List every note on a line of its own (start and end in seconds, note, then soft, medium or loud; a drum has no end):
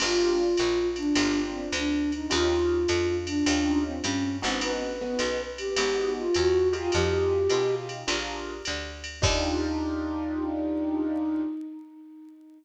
0.00 0.55 G1 medium
0.00 0.45 A#3 medium
0.00 0.45 D4 medium
0.00 0.45 F4 medium
0.00 0.76 F4 loud
0.00 0.45 G4 medium
0.00 crash loud
0.00 ride loud
0.57 1.13 A#1 medium
0.57 hi-hat pedal medium
0.57 ride medium
0.96 1.40 D4 loud
0.96 ride medium
1.15 1.69 G1 medium
1.15 1.62 A#3 medium
1.15 1.62 D4 medium
1.15 1.62 F4 medium
1.15 1.62 G4 medium
1.15 ride loud
1.52 1.69 C4 medium
1.72 2.26 D2 medium
1.72 2.11 D4 medium
1.72 hi-hat pedal medium
1.72 ride medium
2.12 2.32 D#4 medium
2.12 ride medium
2.28 2.86 D#2 loud
2.28 2.76 C#4 medium
2.28 2.76 D#4 medium
2.28 3.05 F4 medium
2.28 2.76 F4 medium
2.28 2.76 G4 medium
2.28 ride loud
2.88 3.43 F2 medium
2.88 hi-hat pedal medium
2.88 ride medium
3.26 3.81 D4 loud
3.26 ride medium
3.46 4.00 D#2 medium
3.46 3.93 C#4 medium
3.46 3.93 D#4 medium
3.46 3.93 F4 medium
3.46 3.93 G4 medium
3.46 ride loud
3.86 4.04 C4 medium
4.02 4.41 G2 medium
4.02 4.36 C#4 loud
4.02 hi-hat pedal medium
4.02 ride medium
4.42 5.17 G#1 medium
4.42 4.88 B3 medium
4.42 4.62 C4 medium
4.42 4.88 D#4 medium
4.42 4.88 F#4 medium
4.42 4.88 G#4 medium
4.42 ride medium
4.61 5.41 B4 loud
4.61 ride loud
5.01 5.36 B3 medium
5.01 5.36 D#4 medium
5.01 5.36 F#4 medium
5.01 5.36 G#4 medium
5.19 5.73 B1 medium
5.19 hi-hat pedal medium
5.19 ride loud
5.58 6.11 G4 medium
5.58 ride medium
5.76 6.30 G#1 medium
5.76 6.24 B3 medium
5.76 6.24 D#4 medium
5.76 6.24 F#4 medium
5.76 6.24 G#4 medium
5.76 ride loud
6.18 6.36 F4 loud
6.34 6.90 E2 medium
6.34 6.69 F#4 medium
6.34 hi-hat pedal medium
6.34 ride medium
6.72 7.38 D#4 medium
6.72 7.38 F4 medium
6.72 6.91 F4 medium
6.72 7.38 G4 medium
6.72 7.38 G#4 medium
6.72 ride medium
6.92 7.48 F2 medium
6.92 7.74 G4 loud
6.92 ride medium
7.50 8.04 B2 medium
7.50 7.98 D#4 medium
7.50 7.98 F4 medium
7.50 7.98 G4 medium
7.50 7.98 G#4 medium
7.50 hi-hat pedal medium
7.50 ride medium
7.89 ride medium
8.07 8.62 A#1 medium
8.07 8.54 D4 medium
8.07 8.54 F4 medium
8.07 8.54 G#4 medium
8.07 8.54 A#4 medium
8.07 ride loud
8.65 9.21 D2 medium
8.65 hi-hat pedal medium
8.65 ride medium
9.04 ride medium
9.21 11.44 D#2 loud
9.21 11.43 D4 loud
9.21 11.42 D#4 loud
9.21 11.43 D#4 loud
9.21 11.43 F4 loud
9.21 11.43 G4 loud
9.21 kick loud
9.21 crash loud